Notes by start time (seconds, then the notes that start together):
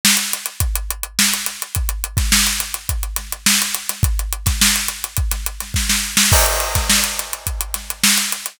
0.05 snare
0.17 closed hi-hat
0.33 closed hi-hat
0.46 closed hi-hat
0.60 kick, closed hi-hat
0.75 closed hi-hat
0.90 closed hi-hat
1.03 closed hi-hat
1.19 snare
1.33 closed hi-hat
1.46 snare, closed hi-hat
1.62 closed hi-hat
1.75 kick, closed hi-hat
1.89 closed hi-hat
2.04 closed hi-hat
2.17 kick, snare, closed hi-hat
2.32 snare
2.47 closed hi-hat
2.60 closed hi-hat
2.74 closed hi-hat
2.89 kick, closed hi-hat
3.03 closed hi-hat
3.16 snare, closed hi-hat
3.32 closed hi-hat
3.46 snare
3.62 closed hi-hat
3.75 closed hi-hat
3.89 snare, closed hi-hat
4.03 kick, closed hi-hat
4.19 closed hi-hat
4.33 closed hi-hat
4.46 kick, snare, closed hi-hat
4.61 snare
4.76 closed hi-hat
4.88 closed hi-hat
5.04 closed hi-hat
5.17 kick, closed hi-hat
5.31 snare, closed hi-hat
5.46 closed hi-hat
5.60 snare, closed hi-hat
5.74 kick, snare
5.89 snare
6.17 snare
6.32 kick, crash
6.46 closed hi-hat
6.60 closed hi-hat
6.75 kick, snare, closed hi-hat
6.90 snare
7.04 closed hi-hat
7.19 closed hi-hat
7.33 closed hi-hat
7.47 kick, closed hi-hat
7.61 closed hi-hat
7.74 snare, closed hi-hat
7.90 closed hi-hat
8.03 snare
8.17 snare, closed hi-hat
8.32 closed hi-hat
8.46 closed hi-hat